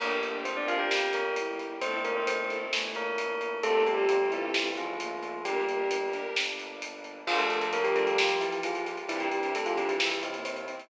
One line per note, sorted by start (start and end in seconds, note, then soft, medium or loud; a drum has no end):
0.00 0.83 G1 medium
0.00 0.10 A#3 medium
0.00 0.90 A#3 medium
0.00 0.42 A#3 medium
0.00 0.16 D4 medium
0.00 0.90 D4 medium
0.00 0.16 G4 loud
0.00 0.90 G4 medium
0.00 0.10 A#4 medium
0.00 0.16 A#4 loud
0.00 kick medium
0.00 crash medium
0.23 0.50 D4 medium
0.23 0.50 G4 medium
0.23 0.50 A#4 medium
0.23 closed hi-hat medium
0.45 0.56 C4 medium
0.45 1.22 C4 medium
0.45 0.56 C5 medium
0.45 closed hi-hat medium
0.57 0.68 D4 medium
0.57 0.94 D4 medium
0.57 0.94 G4 medium
0.57 0.94 A#4 medium
0.57 0.68 D5 medium
0.68 0.79 F4 medium
0.68 0.79 F5 medium
0.68 closed hi-hat medium
0.79 1.09 G4 medium
0.79 1.09 G5 medium
0.91 1.75 G1 medium
0.91 1.81 G3 medium
0.91 1.81 A#3 medium
0.91 1.81 G4 medium
0.91 snare medium
1.13 1.35 A#3 medium
1.13 1.35 A#4 medium
1.13 closed hi-hat medium
1.36 1.79 E4 medium
1.36 closed hi-hat medium
1.59 kick medium
1.59 closed hi-hat medium
1.81 2.65 G1 medium
1.81 2.64 A3 medium
1.81 2.72 A3 medium
1.81 1.99 C4 medium
1.81 2.02 C4 medium
1.81 2.72 C4 medium
1.81 1.99 E4 loud
1.81 2.72 E4 medium
1.81 1.99 A4 loud
1.81 2.02 C5 medium
1.81 kick loud
1.81 closed hi-hat medium
2.04 2.15 A#3 medium
2.04 2.34 C4 medium
2.04 2.34 E4 medium
2.04 2.34 A4 medium
2.04 2.15 A#4 medium
2.04 closed hi-hat medium
2.16 2.27 C4 medium
2.16 2.27 C5 medium
2.27 2.48 C4 medium
2.27 2.48 C5 medium
2.27 closed hi-hat loud
2.39 2.75 C4 medium
2.39 2.75 E4 medium
2.39 2.75 A4 medium
2.50 kick medium
2.50 closed hi-hat medium
2.72 3.56 G1 medium
2.72 3.62 E3 medium
2.72 3.14 A3 medium
2.72 3.62 A3 medium
2.72 3.62 E4 medium
2.72 snare medium
2.95 3.52 A#3 medium
2.95 3.52 A#4 medium
2.95 closed hi-hat medium
3.18 closed hi-hat medium
3.41 closed hi-hat medium
3.63 4.48 G1 medium
3.63 5.43 G3 medium
3.63 5.43 A3 medium
3.63 3.83 A3 medium
3.63 5.43 C4 medium
3.63 4.79 C4 medium
3.63 3.82 C4 loud
3.63 5.43 F4 medium
3.63 3.82 F4 medium
3.63 3.82 G4 loud
3.63 3.83 A4 loud
3.63 3.82 A4 loud
3.63 kick medium
3.63 closed hi-hat medium
3.85 3.97 G3 medium
3.85 4.13 C4 medium
3.85 4.13 F4 medium
3.85 4.13 G4 medium
3.85 3.97 G4 medium
3.85 4.13 A4 medium
3.85 closed hi-hat medium
3.98 4.08 G3 medium
3.98 4.08 G4 medium
4.09 4.27 G3 medium
4.09 4.27 G4 medium
4.09 closed hi-hat medium
4.20 4.56 C4 medium
4.20 4.56 F4 medium
4.20 4.56 G4 medium
4.20 4.56 A4 medium
4.32 4.75 E3 medium
4.32 4.75 E4 medium
4.32 closed hi-hat medium
4.54 5.38 G1 medium
4.54 snare medium
4.77 5.41 F3 medium
4.77 5.41 F4 medium
4.77 closed hi-hat medium
4.99 5.39 A#3 medium
4.99 closed hi-hat medium
5.23 closed hi-hat medium
5.44 6.29 G1 medium
5.44 7.24 G3 medium
5.44 6.06 G3 medium
5.44 7.24 A#3 medium
5.44 5.86 A#3 medium
5.44 7.24 D4 medium
5.44 5.63 D4 loud
5.44 6.06 G4 medium
5.44 5.63 G4 loud
5.44 5.63 A#4 medium
5.44 kick medium
5.44 closed hi-hat medium
5.69 5.96 D4 medium
5.69 5.96 G4 medium
5.69 5.96 A#4 medium
5.69 closed hi-hat medium
5.91 closed hi-hat loud
6.03 6.40 D4 medium
6.03 6.40 G4 medium
6.03 6.40 A#4 medium
6.13 kick medium
6.13 closed hi-hat medium
6.36 7.20 G1 medium
6.36 snare loud
6.59 closed hi-hat medium
6.82 closed hi-hat loud
7.04 closed hi-hat medium
7.26 8.96 F3 medium
7.26 7.38 F3 medium
7.26 7.44 G3 loud
7.26 8.17 G3 medium
7.26 8.17 A#3 medium
7.26 7.44 D4 medium
7.26 8.17 D4 medium
7.26 7.44 F4 loud
7.26 7.38 F4 loud
7.26 8.17 F4 medium
7.26 7.44 A#4 loud
7.26 kick medium
7.26 crash loud
7.39 7.67 A3 medium
7.39 7.67 A4 medium
7.39 closed hi-hat medium
7.50 7.78 G3 medium
7.50 7.78 D4 medium
7.50 7.78 F4 medium
7.50 7.78 A#4 medium
7.50 closed hi-hat medium
7.61 closed hi-hat medium
7.73 7.84 A#3 medium
7.73 7.84 A#4 medium
7.73 closed hi-hat medium
7.84 7.94 G3 medium
7.84 8.21 G3 medium
7.84 8.21 D4 loud
7.84 8.21 F4 medium
7.84 7.94 G4 medium
7.84 8.21 A#4 loud
7.84 closed hi-hat medium
7.96 8.06 A3 medium
7.96 8.06 A4 medium
7.96 closed hi-hat medium
8.07 8.39 G3 medium
8.07 8.39 G4 medium
8.07 closed hi-hat medium
8.18 9.07 G3 medium
8.18 9.09 A#3 medium
8.18 9.09 F4 medium
8.18 9.09 G4 medium
8.18 snare loud
8.29 closed hi-hat medium
8.41 8.61 E3 medium
8.41 8.61 E4 medium
8.41 closed hi-hat medium
8.52 closed hi-hat medium
8.63 8.83 F3 medium
8.63 8.83 F4 medium
8.63 closed hi-hat medium
8.75 closed hi-hat medium
8.86 closed hi-hat medium
8.97 closed hi-hat medium
9.08 9.98 C3 medium
9.08 9.27 C3 loud
9.08 9.20 E3 medium
9.08 9.98 G3 medium
9.08 9.92 C4 loud
9.08 9.98 D4 medium
9.08 9.27 D4 loud
9.08 9.98 E4 medium
9.08 9.20 E4 medium
9.08 9.27 E4 loud
9.08 9.27 G4 medium
9.08 kick medium
9.08 closed hi-hat medium
9.20 9.50 G3 medium
9.20 9.50 G4 medium
9.20 closed hi-hat medium
9.32 9.60 C3 medium
9.32 9.60 D4 medium
9.32 9.60 E4 medium
9.32 9.60 G4 medium
9.32 closed hi-hat medium
9.43 closed hi-hat medium
9.55 9.66 A3 medium
9.55 9.66 A4 medium
9.55 closed hi-hat medium
9.65 10.01 C3 medium
9.65 9.77 F3 medium
9.65 10.01 D4 medium
9.65 10.01 E4 medium
9.65 9.77 F4 medium
9.65 10.01 G4 medium
9.65 closed hi-hat medium
9.77 9.89 G3 medium
9.77 9.89 G4 medium
9.77 closed hi-hat medium
9.89 10.20 E3 medium
9.89 10.20 E4 medium
9.89 closed hi-hat medium
10.00 10.89 C3 medium
10.00 10.89 G3 medium
10.00 10.89 C4 medium
10.00 10.89 E4 medium
10.00 snare loud
10.11 closed hi-hat medium
10.23 10.44 C3 medium
10.23 10.44 C4 medium
10.23 kick medium
10.23 closed hi-hat medium
10.34 10.63 A#3 medium
10.34 closed hi-hat medium
10.45 10.66 C3 medium
10.45 10.66 C4 medium
10.45 closed hi-hat medium
10.56 closed hi-hat medium
10.68 10.87 C4 medium
10.68 closed hi-hat medium
10.80 closed hi-hat medium